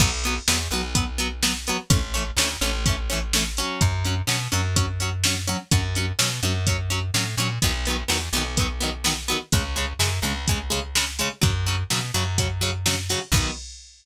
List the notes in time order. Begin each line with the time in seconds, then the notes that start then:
0.00 B1 F#3 B3, kick, crash
0.24 F#3 B3, closed hi-hat
0.48 E2 F#3 B3, snare
0.71 B1 F#3 B3, closed hi-hat
0.95 F#3 B3, kick, closed hi-hat
1.18 F#3 B3, closed hi-hat
1.43 F#3 B3, snare
1.67 F#3 B3, closed hi-hat
1.90 A1 E3 A3 C#4, kick, closed hi-hat
2.14 E3 A3 C#4, closed hi-hat
2.37 D2 A3 C#4, snare
2.42 E3
2.61 A1 E3 A3 C#4, closed hi-hat
2.86 E3 A3 C#4, kick, closed hi-hat
3.10 E3 A3 C#4, closed hi-hat
3.33 E3 A3 C#4, snare
3.57 F#3 C#4, closed hi-hat
3.81 F#2, kick, closed hi-hat
4.05 F#3 C#4, closed hi-hat
4.27 B2 F#3 C#4, snare
4.52 F#2 F#3 C#4, closed hi-hat
4.76 F#3 C#4, kick, closed hi-hat
5.00 F#3 C#4, closed hi-hat
5.24 F#3 C#4, snare
5.47 F#3 C#4, closed hi-hat
5.71 F#2 F#3 C#4, kick, closed hi-hat
5.95 F#3 C#4, closed hi-hat
6.19 B2 F#3 C#4, snare
6.43 F#2 F#3 C#4, closed hi-hat
6.67 F#3 C#4, kick, closed hi-hat
6.90 F#3 C#4, closed hi-hat
7.14 A2 F#3 C#4, snare
7.37 A#2 F#3 C#4, closed hi-hat
7.62 B1 D#3 F#3 B3, kick, closed hi-hat
7.85 F#3 B3, closed hi-hat
7.90 D#3
8.08 E2 D#3 F#3 B3, snare
8.33 B1 D#3 F#3 B3, closed hi-hat
8.57 D#3 F#3 B3, kick, closed hi-hat
8.80 D#3 F#3 B3, closed hi-hat
9.04 D#3 F#3 B3, snare
9.28 D#3 F#3 B3, closed hi-hat
9.52 C#2 C#3 G#3, kick, closed hi-hat
9.76 C#3 G#3, closed hi-hat
9.99 F#2 C#3 G#3, snare
10.22 C#2 C#3 G#3, closed hi-hat
10.48 C#3 G#3, kick, closed hi-hat
10.70 C#3 G#3, closed hi-hat
10.95 C#3 G#3, snare
11.19 C#3 G#3, closed hi-hat
11.41 F#2 C#3 F#3, kick, closed hi-hat
11.66 C#3 F#3, closed hi-hat
11.90 B2 C#3 F#3, snare
12.14 F#2 C#3 F#3, closed hi-hat
12.38 C#3 F#3, kick, closed hi-hat
12.61 C#3 F#3, closed hi-hat
12.86 C#3 F#3, snare
13.09 C#3 F#3, open hi-hat
13.32 B1 F#3 B3, kick, crash
13.37 D#3